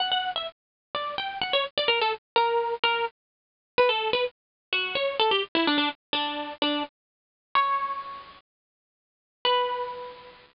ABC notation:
X:1
M:4/4
L:1/16
Q:1/4=127
K:Bm
V:1 name="Acoustic Guitar (steel)"
f f2 e z4 d2 g2 f c z d | ^A =A z2 ^A4 A2 z6 | B A2 B z4 F2 c2 A G z E | D D z2 D4 D2 z6 |
c8 z8 | B16 |]